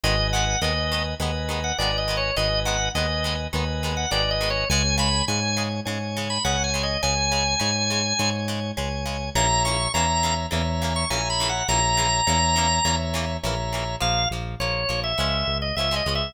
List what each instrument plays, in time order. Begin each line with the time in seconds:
0.04 synth bass 1 G#1, acoustic guitar (steel) D#3 G#3 B3, drawbar organ B4 D#5 G#5
0.33 acoustic guitar (steel) D#3 G#3 B3, drawbar organ F#5
0.62 synth bass 1 D#2, acoustic guitar (steel) D#3 G#3 B3, drawbar organ B4 D#5 G#5
0.92 acoustic guitar (steel) D#3 G#3 B3
1.20 synth bass 1 D#2, acoustic guitar (steel) D#3 G#3 B3, drawbar organ B4 D#5 G#5
1.49 acoustic guitar (steel) D#3 G#3 B3
1.64 drawbar organ F#5
1.78 synth bass 1 G#1, acoustic guitar (steel) D#3 G#3 B3, drawbar organ B4 D5 D#5 G#5
1.98 drawbar organ D#5
2.08 acoustic guitar (steel) D#3 G#3 B3
2.17 drawbar organ C#5
2.37 synth bass 1 G#1, acoustic guitar (steel) D#3 G#3 B3, drawbar organ B4 D#5 G#5
2.65 acoustic guitar (steel) D#3 G#3 B3, drawbar organ F#5
2.95 synth bass 1 D#2, acoustic guitar (steel) D#3 G#3 B3, drawbar organ B4 D#5 G#5
3.24 acoustic guitar (steel) D#3 G#3 B3
3.53 synth bass 1 D#2, acoustic guitar (steel) D#3 G#3 B3, drawbar organ B4 D#5 G#5
3.83 acoustic guitar (steel) D#3 G#3 B3
3.97 drawbar organ F#5
4.11 synth bass 1 G#1, acoustic guitar (steel) D#3 G#3 B3, drawbar organ B4 D5 D#5 G#5
4.31 drawbar organ D#5
4.41 acoustic guitar (steel) D#3 G#3 B3
4.50 drawbar organ C#5
4.70 synth bass 1 C#2, acoustic guitar (steel) C#3 G#3, drawbar organ C#5 G#5
4.98 acoustic guitar (steel) C#3 G#3, drawbar organ B5
5.28 synth bass 1 G#2, acoustic guitar (steel) C#3 G#3, drawbar organ C#5 G#5
5.57 acoustic guitar (steel) C#3 G#3
5.85 synth bass 1 G#2, acoustic guitar (steel) C#3 G#3, drawbar organ C#5 G#5
6.17 acoustic guitar (steel) C#3 G#3
6.30 drawbar organ B5
6.44 synth bass 1 C#2, acoustic guitar (steel) C#3 G#3, drawbar organ C#5 F#5 G#5
6.64 drawbar organ G#5
6.74 acoustic guitar (steel) C#3 G#3
6.83 drawbar organ D#5
7.03 synth bass 1 C#2, acoustic guitar (steel) C#3 G#3, drawbar organ C#5 G#5
7.32 acoustic guitar (steel) C#3 G#3
7.59 synth bass 1 G#2, acoustic guitar (steel) C#3 G#3, drawbar organ C#5 G#5
7.90 acoustic guitar (steel) C#3 G#3
8.19 synth bass 1 G#2, acoustic guitar (steel) C#3 G#3, drawbar organ C#5 G#5
8.48 acoustic guitar (steel) C#3 G#3
8.77 synth bass 1 C#2, acoustic guitar (steel) C#3 G#3, drawbar organ C#5 G#5
9.06 acoustic guitar (steel) C#3 G#3
9.35 synth bass 1 A#1, acoustic guitar (steel) C#3 E3 A#3, drawbar organ C#5 E5 A#5
9.65 acoustic guitar (steel) C#3 E3 A#3, drawbar organ C#6
9.94 synth bass 1 E2, acoustic guitar (steel) C#3 E3 A#3, drawbar organ C#5 E5 A#5
10.23 acoustic guitar (steel) C#3 E3 A#3
10.51 synth bass 1 E2, acoustic guitar (steel) C#3 E3 A#3, drawbar organ C#5 E5 A#5
10.82 acoustic guitar (steel) C#3 E3 A#3
10.96 drawbar organ C#6
11.10 synth bass 1 A#1, acoustic guitar (steel) C#3 E3 A#3, drawbar organ C#5 E5 G#5 A#5
11.30 drawbar organ B5
11.40 acoustic guitar (steel) C#3 E3 A#3
11.49 drawbar organ F#5
11.68 synth bass 1 A#1, acoustic guitar (steel) C#3 E3 A#3, drawbar organ C#5 E5 A#5
11.97 acoustic guitar (steel) C#3 E3 A#3
12.27 synth bass 1 E2, acoustic guitar (steel) C#3 E3 A#3, drawbar organ C#5 E5 A#5
12.56 acoustic guitar (steel) C#3 E3 A#3
12.85 synth bass 1 E2, acoustic guitar (steel) C#3 E3 A#3, drawbar organ C#5 E5 A#5
13.14 acoustic guitar (steel) C#3 E3 A#3
13.43 synth bass 1 A#1, acoustic guitar (steel) C#3 E3 A#3, drawbar organ C#5 E5 A#5
13.73 acoustic guitar (steel) C#3 E3 A#3
14.00 synth bass 1 A#1, acoustic guitar (steel) F3 A#3, drawbar organ F5
14.31 synth bass 1 A#1, acoustic guitar (steel) F3 A#3
14.60 synth bass 1 A#1, acoustic guitar (steel) F3 A#3, drawbar organ C#5
14.89 synth bass 1 A#1, acoustic guitar (steel) F3 A#3
15.04 drawbar organ E5
15.18 synth bass 1 C#2, acoustic guitar (steel) F3 G#3 C#4
15.47 synth bass 1 C#2
15.62 drawbar organ D#5
15.76 synth bass 1 C#2, acoustic guitar (steel) F3 G#3, drawbar organ E5
15.80 acoustic guitar (steel) C#4
15.91 acoustic guitar (steel) F3 G#3 C#4
15.96 drawbar organ D#5
16.06 synth bass 1 C#2, acoustic guitar (steel) F3 G#3 C#4
16.15 drawbar organ E5